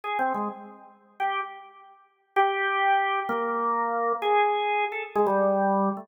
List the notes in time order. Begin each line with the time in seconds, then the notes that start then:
0.04 G#4
0.19 C4
0.34 G#3
1.20 G4
2.36 G4
3.29 A#3
4.22 G#4
4.92 A4
5.15 G#3
5.26 G3
5.97 A3